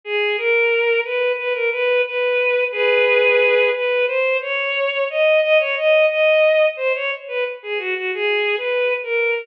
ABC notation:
X:1
M:4/4
L:1/16
Q:1/4=89
K:G#m
V:1 name="Violin"
G2 A4 B2 B A B2 B4 | [M:2/4] [GB]6 B2 | [M:4/4] ^B2 c4 d2 d c d2 d4 | ^B c z =B z G F F (3G4 B4 A4 |]